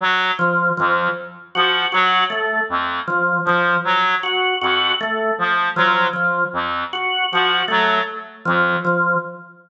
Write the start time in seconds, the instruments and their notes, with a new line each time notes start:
0.00 clarinet F#3
0.39 drawbar organ F3
0.77 clarinet F2, drawbar organ F3
1.55 clarinet F3, drawbar organ F#4
1.92 clarinet F#3, drawbar organ F#4
2.30 drawbar organ A3
2.69 clarinet F2
3.08 drawbar organ F3
3.44 clarinet F3, drawbar organ F3
3.84 clarinet F#3
4.23 drawbar organ F#4
4.61 clarinet F2, drawbar organ F#4
5.01 drawbar organ A3
5.38 clarinet F3
5.76 drawbar organ F3, clarinet F#3
6.13 drawbar organ F3
6.53 clarinet F2
6.93 drawbar organ F#4
7.32 clarinet F3, drawbar organ F#4
7.68 clarinet F#3, drawbar organ A3
8.45 clarinet F2, drawbar organ F3
8.85 drawbar organ F3